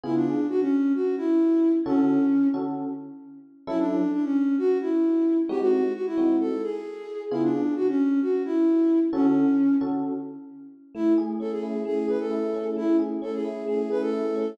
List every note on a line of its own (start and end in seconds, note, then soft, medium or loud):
0.04 0.35 C#3 loud
0.04 0.35 B3 medium
0.04 0.14 E4 medium
0.04 0.35 F4 loud
0.04 0.35 G#4 medium
0.15 0.47 D4 medium
0.49 0.60 F#4 medium
0.61 0.93 C#4 medium
0.95 1.15 F#4 medium
1.17 1.72 E4 medium
1.85 2.18 D3 loud
1.85 2.48 C#4 medium
1.85 2.18 C#4 medium
1.85 2.18 F#4 loud
1.85 2.18 A4 loud
2.54 2.86 D3 medium
2.54 2.86 C#4 medium
2.54 2.86 F#4 medium
2.54 2.86 A4 medium
3.67 3.99 F#3 loud
3.67 3.99 C#4 loud
3.67 3.78 E4 medium
3.67 3.99 E4 loud
3.67 3.99 A4 loud
3.79 4.12 D4 medium
4.13 4.24 D4 medium
4.24 4.56 C#4 medium
4.58 4.78 F#4 medium
4.81 5.37 E4 medium
5.49 5.81 G#3 loud
5.49 5.81 C4 loud
5.49 5.81 D#4 loud
5.49 5.81 F#4 loud
5.49 5.60 G4 medium
5.61 5.93 F#4 medium
5.95 6.05 F#4 medium
6.06 6.36 E4 medium
6.18 6.49 G#3 medium
6.18 6.49 C4 medium
6.18 6.49 D#4 medium
6.18 6.49 F#4 medium
6.40 6.62 A4 medium
6.63 7.22 G#4 medium
7.31 7.63 C#3 loud
7.31 7.63 B3 medium
7.31 7.42 E4 medium
7.31 7.63 F4 loud
7.31 7.63 G#4 medium
7.43 7.74 D4 medium
7.76 7.87 F#4 medium
7.88 8.20 C#4 medium
8.22 8.42 F#4 medium
8.45 9.00 E4 medium
9.13 9.45 D3 loud
9.13 9.45 C#4 medium
9.13 9.76 C#4 medium
9.13 9.45 F#4 loud
9.13 9.45 A4 loud
9.81 10.13 D3 medium
9.81 10.13 C#4 medium
9.81 10.13 F#4 medium
9.81 10.13 A4 medium
10.95 11.85 A3 loud
10.95 11.13 E4 medium
11.18 12.07 G#4 medium
11.40 12.54 C#4 medium
11.40 11.51 A4 medium
11.51 11.81 G#4 medium
11.63 12.30 E4 medium
11.85 12.76 A3 medium
11.85 12.07 G#4 medium
12.08 12.98 G#4 medium
12.08 12.19 B4 medium
12.20 12.67 A4 medium
12.31 13.44 E4 medium
12.54 13.21 C#4 medium
12.77 13.67 A3 medium
12.77 12.96 E4 medium
12.99 13.90 G#4 medium
13.22 14.35 C#4 medium
13.22 13.33 A4 medium
13.34 13.65 G#4 medium
13.45 14.12 E4 medium
13.68 14.54 A3 medium
13.68 13.89 G#4 medium
13.90 14.55 G#4 medium
13.90 14.01 B4 medium
14.01 14.50 A4 medium
14.13 14.56 E4 medium
14.36 14.57 C#4 medium